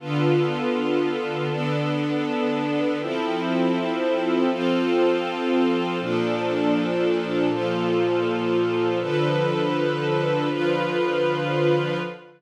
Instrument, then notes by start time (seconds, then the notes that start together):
string ensemble 1
0.00 D3 B3 F4 A4
1.50 D3 B3 D4 A4
3.00 F3 C4 E4 A4
4.50 F3 C4 F4 A4
6.00 A#2 F3 D4 A4
7.50 A#2 F3 F4 A4
9.00 D3 F3 A4 B4
10.50 D3 F3 F4 B4